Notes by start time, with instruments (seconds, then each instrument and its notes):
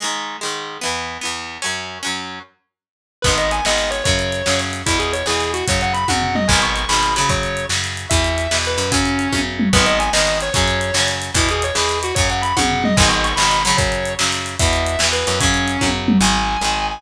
0.00 acoustic guitar (steel) G#2 D#3 G#3
0.41 acoustic guitar (steel) G#2 D#3 G#3
0.81 acoustic guitar (steel) E2 E3 B3
1.21 acoustic guitar (steel) E2 E3 B3
1.62 acoustic guitar (steel) F#2 F#3 C#4
2.03 acoustic guitar (steel) F#2 F#3 C#4
3.22 electric bass (finger) G#1, acoustic guitar (steel) G#3 B3, distortion guitar B4, kick, crash
3.28 acoustic guitar (steel) D#3
3.38 distortion guitar D#5, closed hi-hat
3.51 distortion guitar G#5, closed hi-hat
3.65 electric bass (finger) G#1, acoustic guitar (steel) D#3 G#3 B3, distortion guitar D#5, snare
3.78 closed hi-hat
3.91 distortion guitar C#5, closed hi-hat
4.04 electric bass (finger) F#2, acoustic guitar (steel) C#3 F#3, distortion guitar C#5, kick, closed hi-hat
4.19 closed hi-hat
4.32 closed hi-hat
4.46 electric bass (finger) F#2, acoustic guitar (steel) C#3 F#3, snare
4.59 closed hi-hat
4.73 closed hi-hat
4.86 electric bass (finger) E2, acoustic guitar (steel) B2 E3, distortion guitar E4, kick, closed hi-hat
4.99 distortion guitar G#4, closed hi-hat
5.13 distortion guitar C#5, closed hi-hat
5.26 electric bass (finger) E2, acoustic guitar (steel) B2 E3, distortion guitar G#4, snare
5.41 closed hi-hat
5.54 distortion guitar F#4, closed hi-hat
5.68 electric bass (finger) F#2, acoustic guitar (steel) C#3 F#3, distortion guitar C#5, kick, closed hi-hat
5.81 distortion guitar F#5, closed hi-hat
5.93 distortion guitar B5, closed hi-hat
6.08 electric bass (finger) F#2, acoustic guitar (steel) C#3 F#3, distortion guitar F#5, kick, high tom
6.22 floor tom
6.35 distortion guitar D#5, mid tom
6.48 electric bass (finger) G#1, acoustic guitar (steel) D#3 G#3, distortion guitar G#5, kick, crash
6.52 acoustic guitar (steel) B2
6.62 distortion guitar C#6, closed hi-hat
6.76 distortion guitar C#6, closed hi-hat
6.89 electric bass (finger) G#1, acoustic guitar (steel) D#3 G#3, distortion guitar B5, snare
6.93 acoustic guitar (steel) B2
7.03 closed hi-hat
7.16 acoustic guitar (steel) C#3 F#3, distortion guitar B5, closed hi-hat
7.29 electric bass (finger) F#2, distortion guitar C#5, kick, closed hi-hat
7.43 closed hi-hat
7.57 closed hi-hat
7.69 electric bass (finger) F#2, acoustic guitar (steel) C#3 F#3, snare
7.84 closed hi-hat
7.97 closed hi-hat
8.10 electric bass (finger) E2, acoustic guitar (steel) B2 E3, distortion guitar E5, kick, closed hi-hat
8.24 closed hi-hat
8.38 closed hi-hat
8.51 electric bass (finger) E2, acoustic guitar (steel) B2 E3, snare
8.65 distortion guitar B4, closed hi-hat
8.78 electric bass (finger) F#2, closed hi-hat
8.92 acoustic guitar (steel) C#3 F#3, distortion guitar C#4, kick, closed hi-hat
9.05 closed hi-hat
9.19 closed hi-hat
9.32 electric bass (finger) F#2, acoustic guitar (steel) C#3 F#3, kick, high tom
9.59 mid tom
9.73 electric bass (finger) G#1, acoustic guitar (steel) D#3 G#3 B3, distortion guitar B4, kick, crash
9.86 distortion guitar D#5, closed hi-hat
10.00 distortion guitar G#5, closed hi-hat
10.13 electric bass (finger) G#1, acoustic guitar (steel) D#3 G#3 B3, distortion guitar D#5, snare
10.27 closed hi-hat
10.41 distortion guitar C#5, closed hi-hat
10.53 electric bass (finger) F#2, acoustic guitar (steel) C#3 F#3, distortion guitar C#5, kick, closed hi-hat
10.68 closed hi-hat
10.81 closed hi-hat
10.94 electric bass (finger) F#2, acoustic guitar (steel) C#3 F#3, snare
11.08 closed hi-hat
11.22 closed hi-hat
11.34 electric bass (finger) E2, acoustic guitar (steel) B2 E3, distortion guitar E4, kick, closed hi-hat
11.49 distortion guitar G#4, closed hi-hat
11.62 distortion guitar C#5, closed hi-hat
11.75 electric bass (finger) E2, acoustic guitar (steel) B2 E3, distortion guitar G#4, snare
11.89 closed hi-hat
12.03 distortion guitar F#4, closed hi-hat
12.15 electric bass (finger) F#2, acoustic guitar (steel) C#3 F#3, distortion guitar C#5, kick, closed hi-hat
12.30 distortion guitar F#5, closed hi-hat
12.42 distortion guitar B5, closed hi-hat
12.57 electric bass (finger) F#2, acoustic guitar (steel) C#3 F#3, distortion guitar F#5, kick, high tom
12.70 floor tom
12.84 distortion guitar D#5, mid tom
12.97 electric bass (finger) G#1, acoustic guitar (steel) D#3 G#3, distortion guitar G#5, kick, crash
13.02 acoustic guitar (steel) B2
13.09 distortion guitar C#6, closed hi-hat
13.24 distortion guitar C#6, closed hi-hat
13.36 electric bass (finger) G#1, acoustic guitar (steel) G#3, distortion guitar B5, snare
13.40 acoustic guitar (steel) B2 D#3
13.51 closed hi-hat
13.65 acoustic guitar (steel) C#3 F#3, distortion guitar B5, closed hi-hat
13.77 electric bass (finger) F#2, distortion guitar C#5, kick, closed hi-hat
13.92 closed hi-hat
14.05 closed hi-hat
14.19 electric bass (finger) F#2, acoustic guitar (steel) C#3 F#3, snare
14.32 closed hi-hat
14.46 closed hi-hat
14.59 electric bass (finger) E2, acoustic guitar (steel) B2 E3, distortion guitar E5, kick, closed hi-hat
14.73 closed hi-hat
14.86 closed hi-hat
14.99 electric bass (finger) E2, acoustic guitar (steel) B2 E3, snare
15.13 distortion guitar B4, closed hi-hat
15.27 electric bass (finger) F#2, closed hi-hat
15.40 acoustic guitar (steel) C#3 F#3, distortion guitar C#4, kick, closed hi-hat
15.54 closed hi-hat
15.68 closed hi-hat
15.81 electric bass (finger) F#2, acoustic guitar (steel) C#3 F#3, kick, high tom
16.08 mid tom
16.21 electric bass (finger) G#1, acoustic guitar (steel) D#3 G#3, distortion guitar G#5
16.61 electric bass (finger) G#1, acoustic guitar (steel) D#3 G#3
16.91 distortion guitar G#5